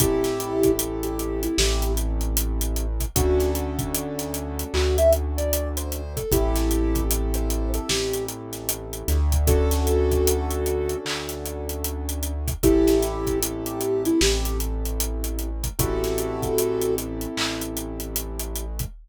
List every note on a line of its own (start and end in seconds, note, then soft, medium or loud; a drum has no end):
0.00 1.48 A1 medium
0.00 2.86 C4 medium
0.00 0.71 E4 loud
0.00 2.86 E4 medium
0.00 0.71 G4 loud
0.00 2.86 G4 medium
0.00 2.86 A4 medium
0.00 kick loud
0.00 closed hi-hat loud
0.24 snare medium
0.24 closed hi-hat medium
0.40 closed hi-hat medium
0.63 kick medium
0.63 closed hi-hat medium
0.79 closed hi-hat loud
1.03 1.41 G4 medium
1.03 closed hi-hat medium
1.19 closed hi-hat medium
1.43 1.57 E4 loud
1.43 closed hi-hat medium
1.58 3.06 A1 medium
1.58 1.92 G4 loud
1.58 snare loud
1.82 closed hi-hat medium
1.97 closed hi-hat medium
2.21 closed hi-hat medium
2.37 closed hi-hat loud
2.61 closed hi-hat medium
2.76 closed hi-hat medium
3.00 kick medium
3.00 closed hi-hat medium
3.16 4.64 D2 loud
3.16 6.02 C#4 medium
3.16 6.02 D4 medium
3.16 6.02 F#4 medium
3.16 3.50 F#4 loud
3.16 6.02 A4 medium
3.16 kick loud
3.16 closed hi-hat loud
3.40 snare soft
3.40 closed hi-hat medium
3.55 closed hi-hat medium
3.79 kick medium
3.79 closed hi-hat medium
3.94 closed hi-hat loud
4.19 snare soft
4.19 closed hi-hat medium
4.34 closed hi-hat medium
4.59 closed hi-hat medium
4.74 6.22 D2 medium
4.74 4.97 F#4 loud
4.74 clap loud
4.98 5.12 E5 loud
4.98 closed hi-hat medium
5.13 closed hi-hat medium
5.37 5.69 D5 loud
5.37 closed hi-hat medium
5.53 closed hi-hat loud
5.77 6.13 C5 loud
5.77 closed hi-hat medium
5.92 closed hi-hat medium
6.16 6.31 A4 medium
6.16 kick medium
6.16 closed hi-hat medium
6.32 7.80 A1 medium
6.32 9.18 C4 medium
6.32 7.03 E4 medium
6.32 9.18 E4 medium
6.32 7.03 G4 loud
6.32 9.18 G4 medium
6.32 9.18 A4 medium
6.32 kick loud
6.32 closed hi-hat loud
6.56 snare medium
6.56 closed hi-hat medium
6.71 closed hi-hat medium
6.95 kick medium
6.95 closed hi-hat medium
7.11 closed hi-hat loud
7.34 7.69 C5 medium
7.34 closed hi-hat medium
7.50 closed hi-hat medium
7.74 7.89 A4 loud
7.74 closed hi-hat medium
7.89 9.03 A1 medium
7.89 8.25 G4 loud
7.89 snare loud
8.13 closed hi-hat medium
8.28 closed hi-hat medium
8.53 snare soft
8.53 closed hi-hat medium
8.69 closed hi-hat loud
8.93 closed hi-hat medium
9.08 10.95 D2 medium
9.08 snare soft
9.08 closed hi-hat medium
9.32 kick medium
9.32 closed hi-hat medium
9.47 12.33 C#4 medium
9.47 12.33 D4 medium
9.47 10.97 F#4 loud
9.47 12.33 F#4 medium
9.47 10.97 A4 loud
9.47 12.33 A4 loud
9.47 kick loud
9.47 closed hi-hat medium
9.71 snare medium
9.71 closed hi-hat medium
9.87 closed hi-hat medium
10.11 kick medium
10.11 closed hi-hat medium
10.27 closed hi-hat loud
10.50 closed hi-hat medium
10.66 closed hi-hat medium
10.89 closed hi-hat medium
11.05 12.53 D2 medium
11.05 clap loud
11.29 snare soft
11.29 closed hi-hat medium
11.46 closed hi-hat medium
11.69 closed hi-hat medium
11.84 closed hi-hat medium
12.09 closed hi-hat medium
12.23 closed hi-hat medium
12.48 kick medium
12.48 closed hi-hat medium
12.63 14.11 A1 medium
12.63 15.49 C4 medium
12.63 13.39 E4 loud
12.63 15.49 E4 medium
12.63 13.39 G4 loud
12.63 15.49 G4 medium
12.63 15.49 A4 medium
12.63 kick loud
12.63 closed hi-hat medium
12.87 snare medium
12.87 closed hi-hat medium
13.02 snare soft
13.02 closed hi-hat medium
13.27 kick medium
13.27 closed hi-hat medium
13.43 closed hi-hat loud
13.66 14.03 G4 loud
13.66 closed hi-hat medium
13.81 closed hi-hat medium
14.05 14.20 E4 loud
14.05 closed hi-hat medium
14.21 15.69 A1 medium
14.21 14.57 G4 loud
14.21 snare loud
14.45 closed hi-hat medium
14.60 closed hi-hat medium
14.85 closed hi-hat medium
15.00 closed hi-hat loud
15.24 closed hi-hat medium
15.39 closed hi-hat medium
15.64 kick medium
15.64 closed hi-hat medium
15.79 17.27 A1 medium
15.79 18.65 C4 medium
15.79 18.65 E4 medium
15.79 16.95 F#4 loud
15.79 18.65 G4 medium
15.79 18.65 A4 medium
15.79 16.95 A4 loud
15.79 kick loud
15.79 closed hi-hat loud
16.04 snare medium
16.04 closed hi-hat medium
16.18 closed hi-hat medium
16.42 kick medium
16.42 closed hi-hat medium
16.58 closed hi-hat loud
16.81 closed hi-hat medium
16.98 closed hi-hat medium
17.21 closed hi-hat medium
17.37 18.85 A1 medium
17.37 clap loud
17.61 closed hi-hat medium
17.77 closed hi-hat medium
18.00 closed hi-hat medium
18.16 closed hi-hat loud
18.39 closed hi-hat medium
18.56 closed hi-hat medium
18.79 kick medium
18.79 closed hi-hat medium